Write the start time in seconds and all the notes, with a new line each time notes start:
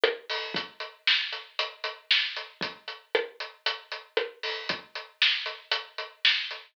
0.04 cross-stick
0.30 open hi-hat
0.54 kick, closed hi-hat
0.80 closed hi-hat
1.07 snare
1.32 closed hi-hat
1.59 closed hi-hat
1.84 closed hi-hat
2.11 snare
2.36 closed hi-hat
2.61 kick, closed hi-hat
2.88 closed hi-hat
3.15 cross-stick
3.40 closed hi-hat
3.66 closed hi-hat
3.92 closed hi-hat
4.17 cross-stick
4.43 open hi-hat
4.69 kick, closed hi-hat
4.95 closed hi-hat
5.22 snare
5.46 closed hi-hat
5.71 closed hi-hat
5.98 closed hi-hat
6.25 snare
6.51 closed hi-hat